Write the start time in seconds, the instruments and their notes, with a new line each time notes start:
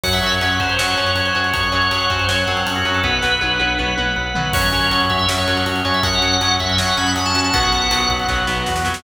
0.04 synth bass 1 F#2, acoustic guitar (steel) F#3 C#4, drawbar organ C#5 F#5, kick, crash
0.13 drawbar organ E5, ride
0.23 synth bass 1 F#2, acoustic guitar (steel) F#3 C#4, ride
0.32 drawbar organ C#5, ride
0.41 synth bass 1 F#2, acoustic guitar (steel) F#3 C#4, drawbar organ C#5 F#5, ride
0.50 ride
0.60 synth bass 1 F#2, acoustic guitar (steel) F#3 C#4, drawbar organ C5, kick, ride
0.69 ride
0.78 synth bass 1 F#2, acoustic guitar (steel) F#3 C#4, drawbar organ C#5 F#5, snare
0.88 ride
0.95 synth bass 1 F#2, acoustic guitar (steel) F#3 C#4, ride
1.07 ride
1.15 synth bass 1 F#2, drawbar organ C#5 F#5, ride
1.25 drawbar organ C5, ride
1.35 synth bass 1 F#2, acoustic guitar (steel) F#3 C#4, ride
1.44 ride
1.53 synth bass 1 F#2, drawbar organ C#5 F#5, kick, ride
1.63 ride
1.72 synth bass 1 F#2, acoustic guitar (steel) F#3 C#4, ride
1.82 ride
1.91 synth bass 1 F#2, acoustic guitar (steel) F#3 C#4, drawbar organ C#5 F#5, ride
2.00 ride
2.10 synth bass 1 F#2, acoustic guitar (steel) F#3 C#4, drawbar organ C5, kick, ride
2.19 ride
2.28 synth bass 1 F#2, acoustic guitar (steel) F#3 C#4, drawbar organ C#5 F#5, snare
2.38 ride
2.47 synth bass 1 F#2, acoustic guitar (steel) F#3 C#4, drawbar organ C4, ride
2.57 ride
2.66 synth bass 1 F#2, drawbar organ C#4 C#5 F#5, ride
2.75 drawbar organ F#4, ride
2.85 synth bass 1 F#2, acoustic guitar (steel) F#3 C#4, ride
2.94 drawbar organ A4, ride
3.04 synth bass 1 B1, acoustic guitar (steel) F#3 B3, drawbar organ B4 F#5, kick
3.22 synth bass 1 B1, acoustic guitar (steel) F#3 B3, snare
3.41 synth bass 1 B1, acoustic guitar (steel) F#3 B3, drawbar organ B4 F#5, high tom
3.60 synth bass 1 B1, acoustic guitar (steel) F#3 B3, high tom
3.79 synth bass 1 B1, acoustic guitar (steel) F#3 B3, drawbar organ B4 F#5, mid tom
3.97 synth bass 1 B1, acoustic guitar (steel) F#3 B3, mid tom
4.16 synth bass 1 B1, drawbar organ B4 F#5
4.35 synth bass 1 B1, acoustic guitar (steel) F#3 B3, floor tom
4.53 synth bass 1 F#2, acoustic guitar (steel) F#3 C#4, drawbar organ C#4 F#4 C#5, kick, crash
4.63 ride
4.72 synth bass 1 F#2, acoustic guitar (steel) F#3 C#4, ride
4.82 ride
4.91 synth bass 1 F#2, acoustic guitar (steel) F#3 C#4, drawbar organ C#4 F#4, ride
5.00 ride
5.10 synth bass 1 F#2, drawbar organ E5, kick, ride
5.19 ride
5.27 synth bass 1 F#2, acoustic guitar (steel) F#3 C#4, drawbar organ C#4 F#4, snare
5.38 drawbar organ C#5, ride
5.48 synth bass 1 F#2, acoustic guitar (steel) F#3 C#4, ride
5.57 ride
5.66 synth bass 1 F#2, drawbar organ C#4 F#4, ride
5.76 ride
5.85 synth bass 1 F#2, acoustic guitar (steel) F#3 C#4, drawbar organ C#5, ride
5.94 drawbar organ E5, ride
6.03 synth bass 1 F#2, drawbar organ C#4 F#4 F#5, kick, ride
6.13 ride
6.21 synth bass 1 F#2, acoustic guitar (steel) F#3 C#4, ride
6.32 ride
6.41 synth bass 1 F#2, acoustic guitar (steel) F#3 C#4, drawbar organ C#4 F#4, ride
6.51 ride
6.60 synth bass 1 F#2, drawbar organ E5, kick, ride
6.70 ride
6.77 synth bass 1 F#2, acoustic guitar (steel) F#3 C#4, drawbar organ C#4 F#4 F#5, snare
6.88 ride
6.97 synth bass 1 F#2, acoustic guitar (steel) F#3 C#4, drawbar organ B5, ride
7.07 ride
7.16 synth bass 1 F#2, drawbar organ C#4 F#4, ride
7.26 drawbar organ A5, ride
7.35 synth bass 1 F#2, acoustic guitar (steel) F#3 C#4, ride
7.44 drawbar organ A5, ride
7.54 synth bass 1 B1, acoustic guitar (steel) F#3 B3, drawbar organ B3 F#4 F#5, kick, ride
7.63 ride
7.72 synth bass 1 B1, acoustic guitar (steel) F#3 B3, ride
7.82 ride
7.90 synth bass 1 B1, acoustic guitar (steel) F#3 B3, drawbar organ B3 F#4, ride
8.01 ride
8.09 synth bass 1 B1, kick, ride
8.19 ride
8.29 synth bass 1 B1, acoustic guitar (steel) F#3 B3, drawbar organ B3 F#4, kick, snare
8.47 synth bass 1 B1, acoustic guitar (steel) F#3 B3, snare
8.66 synth bass 1 E2, drawbar organ B3 F#4, snare
8.76 snare
8.85 synth bass 1 F2, acoustic guitar (steel) F#3 B3, snare
8.94 snare